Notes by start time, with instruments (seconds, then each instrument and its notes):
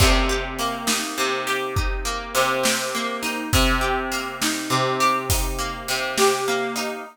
0.00 acoustic guitar (steel) C3, kick, crash
0.29 acoustic guitar (steel) G4
0.59 acoustic guitar (steel) A#3, closed hi-hat
0.87 acoustic guitar (steel) D#4, snare
1.18 acoustic guitar (steel) C3
1.47 acoustic guitar (steel) G4, closed hi-hat
1.76 acoustic guitar (steel) D#4, kick
2.05 acoustic guitar (steel) A#3
2.35 acoustic guitar (steel) C3, closed hi-hat
2.63 acoustic guitar (steel) G4, snare
2.95 acoustic guitar (steel) A#3
3.23 acoustic guitar (steel) D#4, closed hi-hat
3.53 acoustic guitar (steel) C3, kick, closed hi-hat
3.81 acoustic guitar (steel) G4
4.12 acoustic guitar (steel) A#3, closed hi-hat
4.42 acoustic guitar (steel) D#4, snare
4.70 acoustic guitar (steel) C3
5.00 acoustic guitar (steel) G4, closed hi-hat
5.30 acoustic guitar (steel) D#4, kick, closed hi-hat
5.59 acoustic guitar (steel) A#3
5.88 acoustic guitar (steel) C3, closed hi-hat
6.18 acoustic guitar (steel) G4, snare
6.48 acoustic guitar (steel) A#3
6.76 acoustic guitar (steel) D#4, closed hi-hat